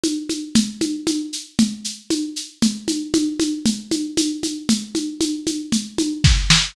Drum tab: SH |xx|xxxxxxxx|xxxxxxxx|xxxxxx--|
SD |--|--------|--------|------oo|
CG |oo|Ooo-O-o-|OoooOooo|OoooOo--|
BD |--|--------|--------|------o-|